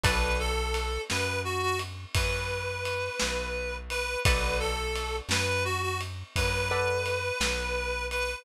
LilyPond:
<<
  \new Staff \with { instrumentName = "Clarinet" } { \time 12/8 \key b \minor \tempo 4. = 57 b'8 a'4 b'8 fis'16 fis'16 r8 b'2~ b'8 b'8 | b'8 a'4 b'8 fis'16 fis'16 r8 b'2~ b'8 b'8 | }
  \new Staff \with { instrumentName = "Acoustic Guitar (steel)" } { \time 12/8 \key b \minor <a' b' d'' fis''>1. | <a' b' d'' fis''>2.~ <a' b' d'' fis''>8 <a' b' d'' fis''>2~ <a' b' d'' fis''>8 | }
  \new Staff \with { instrumentName = "Electric Bass (finger)" } { \clef bass \time 12/8 \key b \minor b,,4. fis,4. fis,4. b,,4. | b,,4. fis,4. fis,4. b,,4. | }
  \new DrumStaff \with { instrumentName = "Drums" } \drummode { \time 12/8 <bd cymr>4 cymr8 sn4 cymr8 <bd cymr>4 cymr8 sn4 cymr8 | <bd cymr>4 cymr8 sn4 cymr8 <bd cymr>4 cymr8 sn4 cymr8 | }
>>